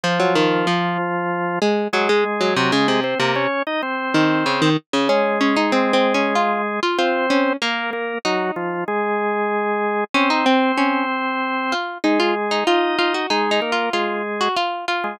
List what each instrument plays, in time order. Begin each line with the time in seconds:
0.04 drawbar organ F3 F4, harpsichord F3
0.20 harpsichord F#3
0.35 harpsichord D#3
0.67 harpsichord F3
1.62 harpsichord G#3
1.93 harpsichord F#3, drawbar organ G#3 G#4
2.09 harpsichord G#3
2.41 harpsichord F#3
2.56 harpsichord C3, drawbar organ F#3 F#4
2.72 harpsichord C#3, drawbar organ G#3 G#4
2.88 harpsichord C3
3.04 drawbar organ C4 C5
3.19 harpsichord C3, drawbar organ A#3 A#4
3.36 drawbar organ C#4 C#5
3.67 drawbar organ D#4 D#5
3.83 drawbar organ C4 C5
4.14 harpsichord D#3
4.46 harpsichord C#3
4.62 harpsichord D#3
4.93 harpsichord C#3
5.09 drawbar organ G#3 G#4, harpsichord C#4
5.41 harpsichord C#4
5.56 harpsichord D#4
5.72 harpsichord C4
5.93 harpsichord C4
6.14 harpsichord C#4
6.35 harpsichord F4
6.83 harpsichord F4
6.98 drawbar organ C4 C5, harpsichord F4
7.30 harpsichord C#4
7.62 harpsichord A#3, drawbar organ A#3 A#4
7.93 drawbar organ A#3 A#4
8.25 drawbar organ F#3 F#4, harpsichord D#4
8.56 drawbar organ F3 F4
8.88 drawbar organ G#3 G#4
10.14 drawbar organ C4 C5, harpsichord C#4
10.30 harpsichord D#4
10.46 harpsichord C4
10.78 harpsichord C#4
11.72 harpsichord F4
12.04 drawbar organ G#3 G#4, harpsichord D#4
12.20 harpsichord F4
12.51 harpsichord D#4
12.67 drawbar organ D#4 D#5, harpsichord F4
12.99 harpsichord F4
13.14 harpsichord F#4
13.30 drawbar organ G#3 G#4, harpsichord D#4
13.51 harpsichord D#4
13.62 drawbar organ A#3 A#4
13.72 harpsichord F4
13.93 drawbar organ G#3 G#4, harpsichord F4
14.41 harpsichord F#4
14.56 harpsichord F4
14.88 harpsichord F4
15.04 drawbar organ G#3 G#4